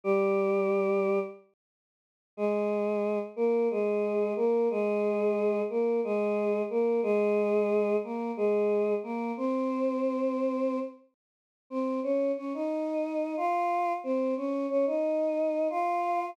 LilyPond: \new Staff { \time 7/8 \key f \minor \tempo 4 = 90 <g g'>2 r4. | <aes aes'>4. <bes bes'>8 <aes aes'>4 <bes bes'>8 | <aes aes'>4. <bes bes'>8 <aes aes'>4 <bes bes'>8 | <aes aes'>4. <bes bes'>8 <aes aes'>4 <bes bes'>8 |
<c' c''>2~ <c' c''>8 r4 | <c' c''>8 <des' des''>8 <des' des''>16 <ees' ees''>4~ <ees' ees''>16 <f' f''>4 | <c' c''>8 <des' des''>8 <des' des''>16 <ees' ees''>4~ <ees' ees''>16 <f' f''>4 | }